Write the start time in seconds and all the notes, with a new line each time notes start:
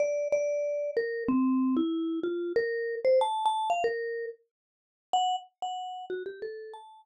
0.00 D5
0.32 D5
0.97 A#4
1.28 C4
1.77 E4
2.23 F4
2.56 A#4
3.05 C5
3.21 A5
3.46 A5
3.70 F5
3.84 A#4
5.13 F#5
5.62 F#5
6.10 F#4
6.26 G4
6.42 A4
6.74 A5